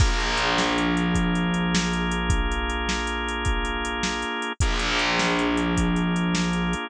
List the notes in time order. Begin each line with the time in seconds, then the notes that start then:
0.00 A#1 A#3 D4 F4 G#4, kick, crash
0.20 closed hi-hat
0.37 closed hi-hat
0.58 snare
0.78 closed hi-hat
0.97 closed hi-hat
1.15 kick, closed hi-hat
1.35 closed hi-hat
1.54 closed hi-hat
1.75 snare
1.93 closed hi-hat
2.11 closed hi-hat
2.30 kick, closed hi-hat
2.52 closed hi-hat
2.70 closed hi-hat
2.89 snare
3.07 closed hi-hat
3.28 closed hi-hat
3.45 kick, closed hi-hat
3.65 closed hi-hat
3.85 closed hi-hat
4.03 snare
4.22 closed hi-hat
4.42 closed hi-hat
4.60 A#1 A#3 D4 F4 G#4, kick, closed hi-hat
4.79 closed hi-hat
4.99 closed hi-hat
5.19 snare
5.39 closed hi-hat
5.57 closed hi-hat
5.77 kick, closed hi-hat
5.96 closed hi-hat
6.16 closed hi-hat
6.35 snare
6.53 closed hi-hat
6.73 closed hi-hat